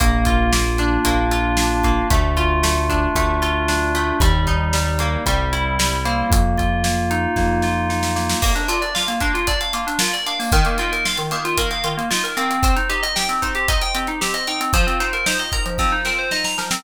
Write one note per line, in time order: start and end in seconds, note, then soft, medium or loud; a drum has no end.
0.00 0.98 A#1 loud
0.00 0.52 A#3 medium
0.00 0.52 A#3 loud
0.00 kick medium
0.00 closed hi-hat loud
0.25 1.31 F4 medium
0.25 kick medium
0.25 closed hi-hat medium
0.52 1.05 A#3 medium
0.52 snare medium
0.78 1.57 D4 medium
0.78 closed hi-hat medium
1.05 2.02 A#1 medium
1.05 1.84 A#3 medium
1.05 kick medium
1.05 closed hi-hat medium
1.31 2.07 F4 medium
1.31 closed hi-hat medium
1.57 2.08 D4 medium
1.57 snare medium
1.83 2.09 A#3 medium
1.83 kick medium
1.83 closed hi-hat medium
2.10 3.08 D2 loud
2.10 2.63 A3 medium
2.10 kick medium
2.10 closed hi-hat medium
2.37 3.41 F4 medium
2.37 3.42 F4 medium
2.37 kick medium
2.37 closed hi-hat medium
2.63 3.15 A3 medium
2.63 snare medium
2.89 3.68 D4 medium
2.89 kick medium
2.89 closed hi-hat medium
3.15 4.12 D2 medium
3.15 3.94 A3 medium
3.15 kick medium
3.15 closed hi-hat medium
3.42 4.17 F4 medium
3.42 closed hi-hat medium
3.68 4.18 D4 medium
3.68 4.19 D4 medium
3.68 snare medium
3.95 4.20 A3 medium
3.95 closed hi-hat medium
4.20 5.17 D#2 loud
4.20 4.73 G3 medium
4.20 4.73 G3 loud
4.20 kick loud
4.20 closed hi-hat medium
4.47 5.22 D#4 medium
4.47 kick medium
4.47 closed hi-hat medium
4.73 5.23 G3 medium
4.73 5.24 G3 medium
4.73 snare medium
4.99 5.25 A#3 medium
4.99 closed hi-hat medium
5.26 6.23 C2 medium
5.26 5.78 G3 medium
5.26 5.79 G3 medium
5.26 kick medium
5.26 closed hi-hat medium
5.53 6.28 E4 medium
5.53 closed hi-hat medium
5.79 6.29 G3 medium
5.79 snare loud
6.05 6.84 A#3 medium
6.05 6.30 C4 medium
6.05 closed hi-hat medium
6.30 7.27 F2 loud
6.30 kick loud
6.30 closed hi-hat medium
6.57 7.63 F4 medium
6.57 kick medium
6.57 closed hi-hat medium
6.84 7.36 A#3 medium
6.84 snare medium
7.11 7.89 D#4 medium
7.11 closed hi-hat medium
7.36 8.34 F2 medium
7.36 8.15 A#3 medium
7.36 kick medium
7.36 snare medium
7.62 8.38 F4 medium
7.62 snare medium
7.89 8.39 D#4 medium
7.89 snare medium
8.03 snare medium
8.16 8.41 A#3 medium
8.16 snare medium
8.29 snare medium
8.42 8.54 A#3 medium
8.42 9.20 A#3 loud
8.42 kick medium
8.42 crash medium
8.55 8.67 D4 medium
8.55 closed hi-hat medium
8.68 9.47 D4 medium
8.68 8.80 F4 medium
8.68 closed hi-hat medium
8.82 8.93 D5 medium
8.82 closed hi-hat medium
8.95 9.73 F4 medium
8.95 9.07 F5 medium
8.95 snare medium
9.08 9.20 A#3 medium
9.08 closed hi-hat medium
9.20 9.99 A#3 medium
9.20 9.33 D4 medium
9.20 kick medium
9.20 closed hi-hat medium
9.34 9.46 F4 medium
9.34 closed hi-hat medium
9.47 10.26 D4 medium
9.47 9.59 D5 medium
9.47 kick medium
9.47 closed hi-hat medium
9.61 9.72 F5 medium
9.61 closed hi-hat medium
9.73 9.86 A#3 medium
9.73 10.49 F4 medium
9.73 closed hi-hat medium
9.87 9.99 D4 medium
9.87 closed hi-hat medium
9.99 10.50 A#3 medium
9.99 10.12 F4 medium
9.99 snare loud
10.13 10.25 D5 medium
10.13 closed hi-hat medium
10.26 10.51 D4 medium
10.26 10.38 F5 medium
10.26 closed hi-hat medium
10.39 10.51 A#3 medium
10.39 open hi-hat medium
10.52 11.31 D#3 loud
10.52 10.64 D#3 loud
10.52 kick loud
10.52 closed hi-hat medium
10.65 10.78 A#3 medium
10.65 closed hi-hat medium
10.78 11.57 A#3 medium
10.78 10.91 F4 medium
10.78 closed hi-hat medium
10.92 11.04 A#4 medium
10.92 closed hi-hat medium
11.05 11.84 F4 medium
11.05 11.17 F5 medium
11.05 snare medium
11.17 11.30 D#3 medium
11.17 closed hi-hat medium
11.31 12.10 D#3 medium
11.31 11.43 A#3 medium
11.31 closed hi-hat medium
11.45 11.57 F4 medium
11.45 closed hi-hat medium
11.57 12.36 A#3 medium
11.57 11.70 A#4 medium
11.57 kick medium
11.57 closed hi-hat medium
11.71 11.83 F5 medium
11.71 closed hi-hat medium
11.84 11.96 D#3 medium
11.84 12.59 F4 medium
11.84 closed hi-hat medium
11.97 12.09 A#3 medium
11.97 closed hi-hat medium
12.11 12.61 D#3 medium
12.11 12.22 F4 medium
12.11 snare medium
12.24 12.36 A#4 medium
12.24 closed hi-hat medium
12.37 12.62 A#3 medium
12.37 12.75 C4 medium
12.37 closed hi-hat medium
12.51 closed hi-hat medium
12.63 13.42 C4 loud
12.63 kick medium
12.63 closed hi-hat medium
12.76 12.88 D#4 medium
12.76 closed hi-hat medium
12.89 13.68 D#4 medium
12.89 13.01 G4 medium
12.89 closed hi-hat medium
13.03 13.14 D#5 medium
13.03 closed hi-hat medium
13.16 13.94 G4 medium
13.16 13.28 G5 medium
13.16 snare medium
13.29 13.41 C4 medium
13.29 closed hi-hat medium
13.42 14.21 C4 medium
13.42 13.54 D#4 medium
13.42 kick medium
13.42 closed hi-hat medium
13.55 13.67 G4 medium
13.55 closed hi-hat medium
13.68 14.47 D#4 medium
13.68 13.80 D#5 medium
13.68 kick medium
13.68 closed hi-hat medium
13.81 13.93 G5 medium
13.81 closed hi-hat medium
13.95 14.07 C4 medium
13.95 14.70 G4 medium
13.95 closed hi-hat medium
14.07 14.20 D#4 medium
14.07 closed hi-hat medium
14.21 14.71 C4 medium
14.21 14.33 G4 medium
14.21 snare medium
14.34 14.46 D#5 medium
14.34 closed hi-hat medium
14.47 14.72 D#4 medium
14.47 14.59 G5 medium
14.47 closed hi-hat medium
14.61 14.72 C4 medium
14.61 closed hi-hat medium
14.73 14.86 F3 loud
14.73 15.78 F3 loud
14.73 kick medium
14.73 closed hi-hat medium
14.87 14.99 C4 medium
14.87 closed hi-hat medium
15.00 16.05 C4 medium
15.00 15.12 D#4 medium
15.00 closed hi-hat medium
15.13 15.25 A#4 medium
15.13 closed hi-hat medium
15.26 16.31 D#4 medium
15.26 15.38 C5 medium
15.26 snare loud
15.39 15.51 D#5 medium
15.39 closed hi-hat medium
15.52 16.57 A#4 medium
15.52 15.64 A#5 medium
15.52 kick medium
15.52 closed hi-hat medium
15.66 15.78 F3 medium
15.66 closed hi-hat medium
15.78 16.79 F3 medium
15.78 15.91 C4 medium
15.78 kick medium
15.78 snare medium
15.92 16.04 D#4 medium
16.05 16.80 C4 medium
16.05 16.17 A#4 medium
16.05 snare medium
16.18 16.30 C5 medium
16.31 16.82 D#4 medium
16.31 16.43 D#5 medium
16.31 snare medium
16.44 16.57 A#5 medium
16.44 snare medium
16.58 16.70 F3 medium
16.58 16.83 A#4 medium
16.58 snare medium
16.71 16.83 C4 medium
16.71 snare loud